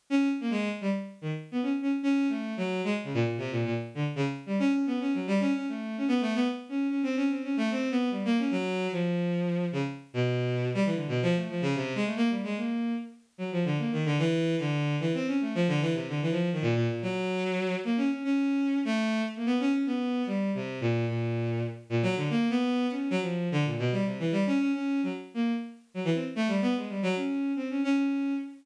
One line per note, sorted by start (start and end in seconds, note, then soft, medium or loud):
0.10 0.28 C#4 loud
0.40 0.50 A#3 medium
0.50 0.69 G#3 loud
0.81 0.90 G3 medium
1.21 1.31 D#3 medium
1.52 1.61 B3 medium
1.63 1.72 C#4 medium
1.82 1.91 C#4 medium
2.03 2.27 C#4 loud
2.29 2.53 A3 medium
2.57 2.81 F#3 medium
2.84 2.93 G#3 medium
3.04 3.13 C#3 medium
3.14 3.23 A#2 medium
3.24 3.36 A#2 medium
3.38 3.50 C3 medium
3.51 3.64 A#2 medium
3.65 3.74 A#2 medium
3.95 4.04 D3 medium
4.16 4.25 C#3 medium
4.46 4.58 G3 medium
4.59 4.72 C#4 loud
4.73 4.86 C#4 medium
4.86 4.98 B3 medium
5.00 5.12 C#4 medium
5.14 5.26 F#3 medium
5.27 5.39 G3 loud
5.40 5.52 C#4 loud
5.54 5.66 C#4 medium
5.68 5.96 A3 medium
5.98 6.07 C#4 medium
6.08 6.20 B3 loud
6.21 6.33 A3 loud
6.35 6.47 B3 loud
6.69 6.87 C#4 medium
6.90 7.02 C#4 medium
7.03 7.15 C4 medium
7.16 7.28 C#4 medium
7.30 7.42 C4 medium
7.43 7.55 C#4 medium
7.57 7.69 A3 loud
7.71 7.89 C4 medium
7.91 8.09 B3 loud
8.11 8.23 G3 medium
8.25 8.37 A#3 loud
8.38 8.51 C#4 medium
8.51 8.87 F#3 loud
8.92 9.65 F3 medium
9.72 9.82 C#3 medium
10.14 10.68 B2 medium
10.74 10.84 G3 loud
10.85 10.94 E3 medium
10.95 11.07 D3 medium
11.08 11.20 B2 medium
11.22 11.34 F3 loud
11.35 11.48 A3 medium
11.49 11.61 F3 medium
11.61 11.74 C#3 loud
11.75 11.93 C3 medium
11.95 12.04 G#3 loud
12.06 12.15 A3 medium
12.16 12.29 A#3 loud
12.29 12.42 G3 soft
12.43 12.56 G#3 medium
12.57 12.93 A#3 soft
13.38 13.50 F#3 medium
13.52 13.64 F3 medium
13.65 13.77 D3 medium
13.78 13.91 A#3 medium
13.92 14.04 D#3 medium
14.05 14.17 D3 loud
14.19 14.55 E3 loud
14.59 14.96 D3 medium
15.00 15.12 E3 medium
15.14 15.26 C4 loud
15.27 15.39 C#4 medium
15.41 15.53 A3 medium
15.55 15.67 F3 loud
15.68 15.80 D3 loud
15.81 15.93 E3 loud
15.94 16.06 C3 medium
16.08 16.20 D3 medium
16.22 16.31 E3 medium
16.31 16.49 F3 medium
16.52 16.61 D#3 medium
16.62 16.74 A#2 loud
16.75 16.87 A#2 loud
16.89 17.01 A#2 medium
17.02 17.75 F#3 loud
17.84 17.97 A#3 medium
17.97 18.09 C#4 medium
18.11 18.23 C#4 medium
18.24 18.79 C#4 medium
18.85 19.22 A3 loud
19.36 19.46 A#3 medium
19.46 19.58 B3 loud
19.60 19.72 C#4 loud
19.73 19.85 C#4 medium
19.86 20.23 B3 medium
20.26 20.51 G3 medium
20.54 20.79 C3 medium
20.81 21.05 A#2 medium
21.08 21.62 A#2 medium
21.90 22.02 A#2 medium
22.03 22.15 F#3 loud
22.16 22.28 D3 medium
22.30 22.48 A#3 loud
22.50 22.86 B3 loud
22.90 23.09 C#4 medium
23.10 23.20 F#3 loud
23.21 23.49 F3 medium
23.52 23.64 D3 loud
23.65 23.77 A#2 medium
23.78 23.91 B2 medium
23.92 24.04 G3 medium
24.05 24.17 C3 medium
24.19 24.31 E3 medium
24.32 24.44 G3 loud
24.46 24.58 C#4 loud
24.60 24.72 C#4 medium
24.73 25.01 C#4 medium
25.03 25.12 F#3 medium
25.34 25.52 A#3 medium
25.94 26.03 F#3 medium
26.05 26.14 E3 medium
26.14 26.24 C4 medium
26.36 26.48 A3 loud
26.48 26.60 G3 medium
26.62 26.74 B3 loud
26.76 26.88 G#3 medium
26.89 27.01 G3 medium
27.03 27.15 F#3 loud
27.16 27.52 C#4 medium
27.56 27.68 C4 medium
27.70 27.83 C#4 medium
27.84 27.96 C#4 loud
27.97 28.33 C#4 medium